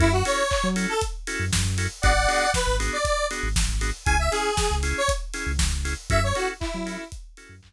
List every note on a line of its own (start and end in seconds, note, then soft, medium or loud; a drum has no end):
0.00 0.23 F#2 loud
0.00 0.09 C#4 medium
0.00 0.09 E4 loud
0.00 0.12 E4 medium
0.00 0.09 F#4 medium
0.00 0.09 A4 loud
0.00 kick loud
0.00 closed hi-hat loud
0.12 0.24 F#4 medium
0.25 0.43 C#4 medium
0.25 0.43 E4 medium
0.25 0.43 F#4 medium
0.25 0.43 A4 medium
0.25 0.67 C#5 medium
0.25 open hi-hat loud
0.51 kick loud
0.51 clap loud
0.64 0.86 F#3 medium
0.76 0.94 C#4 medium
0.76 0.94 E4 medium
0.76 0.94 F#4 medium
0.76 0.94 A4 medium
0.76 open hi-hat medium
0.89 1.01 A4 medium
1.01 kick medium
1.01 closed hi-hat loud
1.27 1.45 C#4 medium
1.27 1.45 E4 medium
1.27 1.45 F#4 medium
1.27 1.45 A4 medium
1.27 open hi-hat medium
1.40 1.51 F#2 medium
1.53 1.64 F#2 medium
1.53 kick medium
1.53 snare loud
1.65 1.88 F#2 medium
1.78 1.87 C#4 medium
1.78 1.87 E4 medium
1.78 1.87 F#4 medium
1.78 1.87 A4 medium
1.78 open hi-hat medium
2.02 2.27 G#1 loud
2.02 2.12 B3 medium
2.02 2.12 D4 medium
2.02 2.12 F#4 medium
2.02 2.12 G#4 medium
2.02 2.51 D5 medium
2.02 2.51 F#5 medium
2.02 kick loud
2.02 closed hi-hat loud
2.28 2.46 B3 medium
2.28 2.46 D4 medium
2.28 2.46 F#4 medium
2.28 2.46 G#4 medium
2.28 open hi-hat medium
2.54 2.76 B4 medium
2.54 kick medium
2.54 snare loud
2.67 2.90 G#1 medium
2.80 2.97 B3 medium
2.80 2.97 D4 medium
2.80 2.97 F#4 medium
2.80 2.97 G#4 medium
2.80 open hi-hat medium
2.93 3.05 D5 medium
3.05 3.26 D5 medium
3.05 kick medium
3.05 closed hi-hat loud
3.31 3.49 B3 medium
3.31 3.49 D4 medium
3.31 3.49 F#4 medium
3.31 3.49 G#4 medium
3.31 open hi-hat medium
3.43 3.55 G#1 medium
3.56 3.68 G#1 medium
3.56 kick loud
3.56 snare loud
3.69 3.92 G#1 medium
3.81 3.90 B3 medium
3.81 3.90 D4 medium
3.81 3.90 F#4 medium
3.81 3.90 G#4 medium
3.81 open hi-hat medium
4.05 4.29 C#2 medium
4.05 4.16 C#4 loud
4.05 4.16 E4 loud
4.05 4.16 G#4 medium
4.05 4.17 G#5 medium
4.05 kick loud
4.05 closed hi-hat loud
4.19 4.31 E5 medium
4.31 4.50 C#4 medium
4.31 4.50 E4 medium
4.31 4.75 G#4 medium
4.31 4.50 G#4 medium
4.31 open hi-hat medium
4.57 kick loud
4.57 snare loud
4.71 4.93 C#2 medium
4.83 5.01 C#4 medium
4.83 5.01 E4 medium
4.83 5.01 G#4 medium
4.83 open hi-hat medium
4.98 5.10 C#5 medium
5.08 kick loud
5.08 closed hi-hat loud
5.33 5.52 C#4 medium
5.33 5.52 E4 medium
5.33 5.52 G#4 medium
5.33 open hi-hat medium
5.47 5.58 C#2 medium
5.59 5.71 C#2 medium
5.59 kick loud
5.59 snare loud
5.72 5.95 C#2 medium
5.85 5.94 C#4 medium
5.85 5.94 E4 medium
5.85 5.94 G#4 medium
5.85 open hi-hat medium
6.10 6.33 F#2 loud
6.10 6.19 C#4 medium
6.10 6.19 E4 medium
6.10 6.19 F#4 medium
6.10 6.19 A4 medium
6.10 6.22 E5 medium
6.10 kick loud
6.10 closed hi-hat loud
6.24 6.36 C#5 medium
6.35 6.53 C#4 medium
6.35 6.53 E4 medium
6.35 6.53 F#4 medium
6.35 6.48 F#4 medium
6.35 6.53 A4 medium
6.35 open hi-hat medium
6.60 7.04 E4 medium
6.60 kick loud
6.60 clap loud
6.74 6.97 F#3 medium
6.86 7.04 C#4 medium
6.86 7.04 E4 medium
6.86 7.04 F#4 medium
6.86 7.04 A4 medium
6.86 open hi-hat medium
7.12 kick loud
7.12 closed hi-hat loud
7.37 7.55 C#4 medium
7.37 7.55 E4 medium
7.37 7.55 F#4 medium
7.37 7.55 A4 medium
7.37 open hi-hat medium
7.49 7.61 F#2 medium
7.63 7.73 F#2 medium
7.63 kick medium
7.63 clap loud